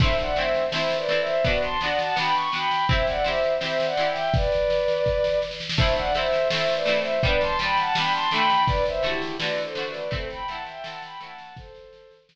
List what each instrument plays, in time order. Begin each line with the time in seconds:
0.00 pizzicato strings A3 C4 E4, violin C5 E5, kick, snare, crash
0.18 violin D5 F#5, snare
0.36 pizzicato strings A3 C4, violin C5 E5, snare
0.40 pizzicato strings E4
0.54 snare
0.72 pizzicato strings A3 C4 E4, violin C5 E5, snare
0.90 snare
0.96 violin B4 D5
1.09 pizzicato strings A3 C4 E4, snare
1.20 violin C5 E5
1.27 snare
1.44 pizzicato strings B3 D4, violin B4 D5, kick, snare
1.48 pizzicato strings F#4
1.62 violin A5 C6, snare
1.81 pizzicato strings B3 D4, violin D5 F#5, snare
1.85 pizzicato strings F#4
1.99 violin F#5 A5, snare
2.16 pizzicato strings B3 D4 F#4, violin G5 B5, snare
2.34 violin C#6, snare
2.52 pizzicato strings B3 D4 F#4, violin G5 B5, snare
2.71 snare
2.89 pizzicato strings C4 E4 G4, violin C5 E5, kick, snare
3.07 violin D5 F#5, snare
3.24 pizzicato strings C4 E4 G4, violin C5 E5, snare
3.43 snare
3.61 pizzicato strings C4 E4 G4, violin C5 E5, snare
3.80 snare
3.85 violin D5 F#5
3.97 pizzicato strings C4 E4 G4, snare
4.10 violin E5 G5
4.16 snare
4.34 violin B4 D5, kick, snare
4.52 snare
4.70 snare
4.88 snare
5.06 kick, snare
5.24 snare
5.42 snare
5.51 snare
5.60 snare
5.69 snare
5.77 pizzicato strings A3 C4, violin C5 E5, kick, snare, crash
5.81 pizzicato strings E4
5.96 violin D5 F#5, snare
6.15 pizzicato strings A3 C4, violin C5 E5, snare
6.19 pizzicato strings E4
6.33 snare
6.50 pizzicato strings A3 C4 E4, violin C5 E5, snare
6.69 snare
6.75 violin B4 D5
6.86 pizzicato strings A3 C4 E4, snare
6.98 violin C5 E5
7.05 snare
7.23 pizzicato strings G3 B3 D4, violin B4 D5, kick
7.40 violin A5 C6, snare
7.59 pizzicato strings G3 B3, violin G5 B5, snare
7.63 pizzicato strings D4
7.77 violin F#5 A5, snare
7.95 pizzicato strings G3 B3 D4, violin G5 B5, snare
8.13 violin A5 C6, snare
8.31 pizzicato strings D3 A3, violin G5 B5, snare
8.36 pizzicato strings F#4
8.50 snare
8.67 violin B4 D5, kick, snare
8.86 violin C5 E5, snare
9.03 pizzicato strings D3 A3 F#4, violin E4 G4, snare
9.22 snare
9.38 pizzicato strings D3 A3, violin B4 D5, snare
9.44 pizzicato strings F#4
9.58 snare
9.63 violin A4 C5
9.75 pizzicato strings D3 A3 F#4, snare
9.88 violin B4 D5
9.94 snare
10.11 pizzicato strings A3 C4 E4, violin A4 C5, kick, snare
10.30 violin G5 B5, snare
10.47 pizzicato strings A3 C4, violin F#5 A5, snare
10.52 pizzicato strings E4
10.66 violin E5 G5, snare
10.84 pizzicato strings A3 C4 E4, violin F#5 A5, snare
11.02 violin G5 B5, snare
11.20 pizzicato strings A3 C4 E4, violin F#5 A5, snare
11.38 snare
11.56 violin A4 C5, kick, snare
11.75 snare
11.93 snare
12.11 snare
12.29 snare